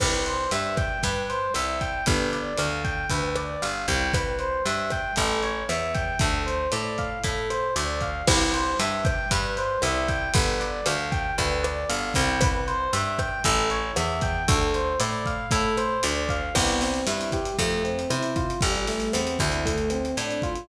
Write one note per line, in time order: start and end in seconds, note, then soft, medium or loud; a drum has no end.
0.00 0.47 C2 loud
0.00 0.23 B4 loud
0.00 kick medium
0.00 cross-stick loud
0.00 crash loud
0.26 0.49 C5 medium
0.26 closed hi-hat medium
0.51 0.98 G2 medium
0.51 0.75 E5 medium
0.51 closed hi-hat medium
0.77 1.01 G5 medium
0.77 kick medium
0.77 cross-stick medium
0.77 closed hi-hat medium
1.03 1.50 G2 medium
1.03 1.27 B4 medium
1.03 kick medium
1.03 closed hi-hat medium
1.29 1.53 C5 medium
1.29 closed hi-hat medium
1.54 2.02 C2 medium
1.54 1.79 E5 medium
1.54 cross-stick medium
1.54 closed hi-hat medium
1.81 2.05 G5 medium
1.81 kick medium
1.81 closed hi-hat medium
2.06 2.53 G1 loud
2.06 2.30 B4 medium
2.06 kick medium
2.06 closed hi-hat loud
2.33 2.56 D5 medium
2.33 closed hi-hat medium
2.58 3.05 D2 medium
2.58 2.82 F5 medium
2.58 cross-stick medium
2.58 closed hi-hat medium
2.84 3.08 G5 medium
2.84 kick medium
2.84 closed hi-hat medium
3.10 3.57 D2 medium
3.10 3.34 B4 medium
3.10 kick medium
3.10 closed hi-hat medium
3.36 3.60 D5 medium
3.36 cross-stick medium
3.36 closed hi-hat medium
3.62 3.87 G1 medium
3.62 3.85 F5 medium
3.62 closed hi-hat medium
3.88 4.60 C2 loud
3.88 4.12 G5 medium
3.88 kick medium
3.88 closed hi-hat medium
4.13 4.37 B4 medium
4.13 kick medium
4.13 cross-stick medium
4.13 closed hi-hat medium
4.39 4.63 C5 medium
4.39 closed hi-hat medium
4.66 5.12 G2 medium
4.66 4.89 E5 medium
4.66 closed hi-hat medium
4.90 5.15 G5 medium
4.90 kick medium
4.90 cross-stick medium
4.90 closed hi-hat medium
5.16 5.64 A1 loud
5.16 5.40 A4 medium
5.16 kick medium
5.16 closed hi-hat medium
5.43 5.66 C#5 medium
5.43 closed hi-hat medium
5.69 6.16 E2 medium
5.69 5.92 E5 medium
5.69 cross-stick medium
5.69 closed hi-hat medium
5.95 6.18 G5 medium
5.95 kick medium
5.95 closed hi-hat medium
6.19 6.67 D2 loud
6.19 6.44 A4 medium
6.19 kick medium
6.19 closed hi-hat medium
6.46 6.70 C5 medium
6.46 closed hi-hat medium
6.72 7.19 A2 medium
6.72 6.96 D5 medium
6.72 cross-stick medium
6.72 closed hi-hat medium
6.98 7.22 F5 medium
6.98 kick medium
6.98 closed hi-hat medium
7.24 7.71 A2 medium
7.24 7.47 A4 medium
7.24 kick medium
7.24 closed hi-hat medium
7.50 7.73 C5 medium
7.50 cross-stick medium
7.50 closed hi-hat medium
7.76 8.22 D2 medium
7.76 7.99 D5 medium
7.76 closed hi-hat medium
8.01 8.25 F5 medium
8.01 kick medium
8.01 closed hi-hat medium
8.27 8.74 C2 loud
8.27 8.51 B4 loud
8.27 kick medium
8.27 cross-stick loud
8.27 crash loud
8.53 8.77 C5 medium
8.53 closed hi-hat medium
8.79 9.26 G2 medium
8.79 9.03 E5 medium
8.79 closed hi-hat loud
9.05 9.28 G5 medium
9.05 kick medium
9.05 cross-stick medium
9.05 closed hi-hat medium
9.31 9.78 G2 loud
9.31 9.55 B4 medium
9.31 kick medium
9.31 closed hi-hat loud
9.57 9.80 C5 medium
9.57 closed hi-hat medium
9.82 10.29 C2 medium
9.82 10.06 E5 medium
9.82 cross-stick medium
9.82 closed hi-hat medium
10.08 10.31 G5 medium
10.08 kick medium
10.08 closed hi-hat medium
10.34 10.81 G1 loud
10.34 10.58 B4 loud
10.34 kick loud
10.34 closed hi-hat loud
10.60 10.84 D5 medium
10.60 closed hi-hat medium
10.86 11.33 D2 medium
10.86 11.10 F5 medium
10.86 cross-stick medium
10.86 closed hi-hat loud
11.12 11.35 G5 medium
11.12 kick medium
11.12 closed hi-hat medium
11.38 11.85 D2 medium
11.38 11.61 B4 medium
11.38 kick medium
11.38 closed hi-hat medium
11.63 11.87 D5 medium
11.63 cross-stick medium
11.63 closed hi-hat medium
11.89 12.14 G1 medium
11.89 12.13 F5 medium
11.89 closed hi-hat medium
12.14 12.88 C2 loud
12.14 12.39 G5 medium
12.14 kick medium
12.14 closed hi-hat medium
12.41 12.65 B4 loud
12.41 kick loud
12.41 cross-stick loud
12.41 closed hi-hat loud
12.67 12.91 C5 medium
12.67 closed hi-hat medium
12.93 13.40 G2 medium
12.93 13.16 E5 medium
12.93 closed hi-hat loud
13.19 13.42 G5 medium
13.19 kick medium
13.19 cross-stick medium
13.19 closed hi-hat medium
13.44 13.91 A1 loud
13.44 13.68 A4 medium
13.44 kick medium
13.44 closed hi-hat medium
13.70 13.94 C#5 medium
13.70 closed hi-hat medium
13.96 14.43 E2 medium
13.96 14.20 E5 medium
13.96 cross-stick medium
13.96 closed hi-hat medium
14.21 14.45 G5 medium
14.21 kick medium
14.21 closed hi-hat medium
14.48 14.95 D2 loud
14.48 14.71 A4 loud
14.48 kick loud
14.48 closed hi-hat loud
14.74 14.98 C5 medium
14.74 closed hi-hat medium
15.00 15.46 A2 medium
15.00 15.23 D5 medium
15.00 cross-stick medium
15.00 closed hi-hat loud
15.26 15.49 F5 medium
15.26 kick medium
15.26 closed hi-hat medium
15.51 15.98 A2 medium
15.51 15.75 A4 medium
15.51 kick medium
15.51 closed hi-hat loud
15.77 16.01 C5 medium
15.77 cross-stick medium
15.77 closed hi-hat medium
16.03 16.50 D2 loud
16.03 16.27 D5 medium
16.03 closed hi-hat loud
16.29 16.53 F5 medium
16.29 kick medium
16.29 closed hi-hat medium
16.55 17.02 C2 loud
16.55 16.79 B3 medium
16.55 kick medium
16.55 cross-stick medium
16.55 crash loud
16.68 closed hi-hat medium
16.81 17.04 C4 medium
16.81 snare medium
16.81 closed hi-hat medium
16.94 closed hi-hat medium
17.07 17.53 G2 medium
17.07 17.30 E4 medium
17.07 closed hi-hat loud
17.21 closed hi-hat medium
17.32 17.56 G4 medium
17.32 kick medium
17.32 cross-stick medium
17.32 closed hi-hat medium
17.45 closed hi-hat medium
17.59 18.05 F2 loud
17.59 17.82 A3 loud
17.59 kick medium
17.59 closed hi-hat medium
17.71 closed hi-hat medium
17.84 18.07 C4 medium
17.84 closed hi-hat medium
17.99 closed hi-hat medium
18.10 18.57 C3 medium
18.10 18.34 E4 medium
18.10 cross-stick medium
18.10 closed hi-hat medium
18.23 closed hi-hat medium
18.36 18.60 F4 medium
18.36 kick medium
18.36 closed hi-hat medium
18.50 closed hi-hat medium
18.61 19.09 A1 loud
18.61 18.85 G3 medium
18.61 kick medium
18.61 closed hi-hat medium
18.75 closed hi-hat medium
18.87 19.11 A3 medium
18.87 snare soft
18.87 closed hi-hat medium
19.00 closed hi-hat medium
19.13 19.38 E2 medium
19.13 19.37 C4 medium
19.13 cross-stick medium
19.13 closed hi-hat loud
19.27 closed hi-hat medium
19.39 20.12 D2 loud
19.39 19.63 E4 medium
19.39 kick medium
19.39 closed hi-hat medium
19.52 closed hi-hat medium
19.65 19.89 A3 loud
19.65 kick medium
19.65 closed hi-hat medium
19.78 closed hi-hat medium
19.90 20.15 C4 medium
19.90 cross-stick medium
19.90 closed hi-hat medium
20.05 closed hi-hat medium
20.17 20.64 A2 medium
20.17 20.41 D4 medium
20.17 closed hi-hat medium
20.31 closed hi-hat medium
20.42 20.66 F4 medium
20.42 kick medium
20.42 closed hi-hat medium
20.55 closed hi-hat medium